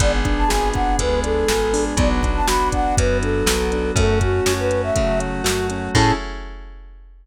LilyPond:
<<
  \new Staff \with { instrumentName = "Flute" } { \time 4/4 \key a \major \tempo 4 = 121 d''16 r8 a''16 gis''8 fis''8 b'8 a'4. | d''16 r8 a''16 b''8 fis''8 b'8 a'4. | a'8 fis'8. b'8 e''8. r4. | a''4 r2. | }
  \new Staff \with { instrumentName = "Acoustic Grand Piano" } { \time 4/4 \key a \major b8 d'8 gis'8 d'8 b8 d'8 gis'8 d'8 | b8 d'8 fis'8 d'8 b8 d'8 fis'8 d'8 | a8 cis'8 fis'8 cis'8 a8 cis'8 fis'8 cis'8 | <cis' e' gis' a'>4 r2. | }
  \new Staff \with { instrumentName = "Electric Bass (finger)" } { \clef bass \time 4/4 \key a \major gis,,4 gis,,4 d,4 gis,,4 | b,,4 b,,4 fis,4 b,,4 | fis,4 fis,4 cis4 fis,4 | a,4 r2. | }
  \new Staff \with { instrumentName = "Pad 5 (bowed)" } { \time 4/4 \key a \major <b d' gis'>2 <gis b gis'>2 | <b d' fis'>2 <fis b fis'>2 | <a cis' fis'>2 <fis a fis'>2 | <cis' e' gis' a'>4 r2. | }
  \new DrumStaff \with { instrumentName = "Drums" } \drummode { \time 4/4 <hh bd>8 <hh bd>8 sn8 <hh bd>8 <hh bd>8 hh8 sn8 hho8 | <hh bd>8 <hh bd>8 sn8 <hh bd>8 <hh bd>8 hh8 sn8 hh8 | <hh bd>8 <hh bd>8 sn8 hh8 <hh bd>8 hh8 sn8 hh8 | <cymc bd>4 r4 r4 r4 | }
>>